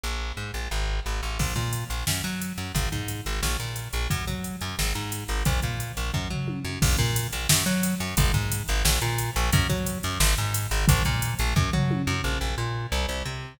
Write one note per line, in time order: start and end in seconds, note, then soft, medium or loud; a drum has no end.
0.03 0.32 A#1 medium
0.37 0.51 G#2 medium
0.54 0.68 A#1 medium
0.71 1.00 G#1 medium
1.06 1.21 G#1 medium
1.23 1.38 A1 medium
1.39 1.54 A#1 medium
1.39 kick medium
1.39 crash medium
1.56 1.84 A#2 medium
1.56 kick medium
1.56 closed hi-hat soft
1.73 closed hi-hat medium
1.90 2.04 A#1 medium
1.90 closed hi-hat medium
2.07 2.22 F#2 medium
2.07 snare loud
2.24 2.53 F#3 medium
2.24 closed hi-hat medium
2.42 closed hi-hat medium
2.57 2.72 F#2 medium
2.57 closed hi-hat medium
2.75 2.89 G#1 medium
2.75 kick medium
2.75 closed hi-hat medium
2.92 3.21 G#2 medium
2.92 kick medium
2.92 closed hi-hat medium
3.08 closed hi-hat medium
3.26 3.40 G#1 medium
3.26 closed hi-hat medium
3.42 3.57 A#1 medium
3.42 snare medium
3.60 3.88 A#2 medium
3.60 closed hi-hat medium
3.76 closed hi-hat medium
3.93 4.08 A#1 medium
3.93 closed hi-hat medium
4.10 4.25 F#2 medium
4.10 kick medium
4.10 closed hi-hat medium
4.27 4.56 F#3 medium
4.27 kick medium
4.27 closed hi-hat medium
4.44 closed hi-hat medium
4.61 4.76 F#2 medium
4.61 closed hi-hat medium
4.79 4.93 G#1 medium
4.79 snare medium
4.95 5.24 G#2 medium
4.95 closed hi-hat medium
5.12 closed hi-hat medium
5.28 5.43 G#1 medium
5.28 closed hi-hat medium
5.45 5.60 A#1 medium
5.45 kick medium
5.45 closed hi-hat medium
5.62 5.92 A#2 medium
5.62 kick medium
5.62 closed hi-hat medium
5.80 closed hi-hat medium
5.97 6.11 A#1 medium
5.97 closed hi-hat medium
6.14 6.28 F#2 medium
6.14 kick medium
6.30 6.59 F#3 medium
6.30 floor tom medium
6.48 high tom medium
6.64 6.79 F#2 medium
6.82 6.96 A#1 loud
6.82 kick loud
6.82 crash loud
6.98 7.27 A#2 loud
6.98 kick medium
6.98 closed hi-hat medium
7.16 closed hi-hat loud
7.32 7.47 A#1 medium
7.32 closed hi-hat medium
7.49 7.64 F#2 loud
7.49 snare loud
7.66 7.95 F#3 loud
7.66 closed hi-hat medium
7.83 closed hi-hat loud
8.00 8.15 F#2 medium
8.00 closed hi-hat medium
8.17 8.32 G#1 loud
8.17 kick loud
8.17 closed hi-hat loud
8.34 8.63 G#2 medium
8.34 kick medium
8.34 closed hi-hat medium
8.52 closed hi-hat loud
8.68 8.83 G#1 loud
8.68 closed hi-hat medium
8.85 8.99 A#1 loud
8.85 snare loud
9.01 9.30 A#2 medium
9.01 closed hi-hat medium
9.18 closed hi-hat medium
9.36 9.50 A#1 loud
9.36 closed hi-hat medium
9.52 9.67 F#2 loud
9.52 kick loud
9.52 closed hi-hat loud
9.69 9.98 F#3 medium
9.69 kick medium
9.69 closed hi-hat medium
9.86 closed hi-hat medium
10.03 10.18 F#2 loud
10.03 closed hi-hat medium
10.20 10.34 G#1 loud
10.20 snare loud
10.37 10.67 G#2 medium
10.37 closed hi-hat medium
10.54 closed hi-hat loud
10.71 10.86 G#1 loud
10.71 closed hi-hat medium
10.88 11.03 A#1 loud
10.88 kick loud
10.88 closed hi-hat loud
11.05 11.34 A#2 loud
11.05 kick medium
11.05 closed hi-hat medium
11.22 closed hi-hat loud
11.39 11.54 A#1 loud
11.39 closed hi-hat medium
11.56 11.70 F#2 loud
11.56 kick loud
11.73 12.02 F#3 medium
11.73 floor tom medium
11.91 high tom medium
12.07 12.21 F#2 loud
12.24 12.38 A#1 medium
12.41 12.55 A#1 medium
12.58 12.87 A#2 medium
12.92 13.06 C2 loud
13.09 13.23 C2 medium
13.25 13.54 C3 medium